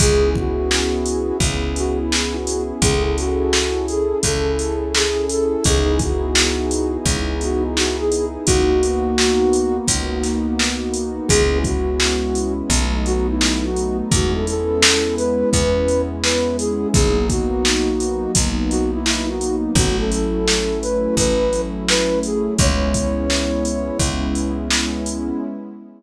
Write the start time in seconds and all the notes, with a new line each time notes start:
0.00 C#2 B3 C#4 E4 G#4, kick, closed hi-hat
0.35 F#4, kick
0.71 snare
1.06 closed hi-hat
1.40 C#2, kick, closed hi-hat
1.76 F#4, closed hi-hat
1.98 E4
2.12 E4, snare
2.34 F#4
2.47 closed hi-hat
2.81 C#2 C#4 E4 G#4 A4, kick, closed hi-hat
3.03 G#4
3.17 F#4, closed hi-hat
3.53 snare
3.88 G#4, closed hi-hat
4.23 C#2 A4, kick, closed hi-hat
4.59 closed hi-hat
4.95 G#4, snare
5.29 A4, closed hi-hat
5.64 C#2 B3 D#4 E4 G#4, kick, closed hi-hat
5.99 F#4, kick, closed hi-hat
6.35 snare
6.71 closed hi-hat
7.05 C#2, kick, closed hi-hat
7.41 F#4, closed hi-hat
7.62 D#4
7.76 F#4, snare
7.98 G#4
8.12 closed hi-hat
8.45 C#2 A#3 B3 D#4 F#4, kick, closed hi-hat
8.83 closed hi-hat
9.18 snare
9.53 closed hi-hat
9.87 C#2, kick, closed hi-hat
10.23 snare, closed hi-hat
10.59 snare
10.94 closed hi-hat
11.27 C#2 G#3 B3 C#4 E4 G#4, kick, closed hi-hat
11.64 F#4, kick, closed hi-hat
12.00 snare
12.35 closed hi-hat
12.70 B1 F#3 A3 B3 D#4, kick, closed hi-hat
13.06 F#4, closed hi-hat
13.29 E4
13.41 E4, snare
13.63 F#4
13.76 closed hi-hat
14.11 E2 G#3 B3 C#4 E4 F#4, kick, closed hi-hat
14.33 A4
14.47 A4, closed hi-hat
14.82 snare
15.16 B4, closed hi-hat
15.52 E2 B4, kick, closed hi-hat
15.88 closed hi-hat
16.22 B4, snare
16.58 G#4, closed hi-hat
16.93 B1 F#3 A#3 B3 D#4 G#4, kick, closed hi-hat
17.29 F#4, kick, closed hi-hat
17.65 snare
18.00 closed hi-hat
18.35 B1, kick, closed hi-hat
18.70 F#4, closed hi-hat
18.92 E4
19.06 E4, snare
19.29 F#4
19.41 closed hi-hat
19.75 A1 F#3 A3 C#4 E4 F#4, kick, closed hi-hat
19.98 A4
20.11 A4, closed hi-hat
20.47 snare
20.81 B4, closed hi-hat
21.16 A1 B4, kick, closed hi-hat
21.53 closed hi-hat
21.88 B4, snare
22.23 G#4, closed hi-hat
22.59 C#2 G#3 B3 C#4 E4 C#5, kick, closed hi-hat
22.94 kick, closed hi-hat
23.30 snare
23.65 closed hi-hat
23.99 C#2, kick, closed hi-hat
24.35 closed hi-hat
24.70 snare
25.06 closed hi-hat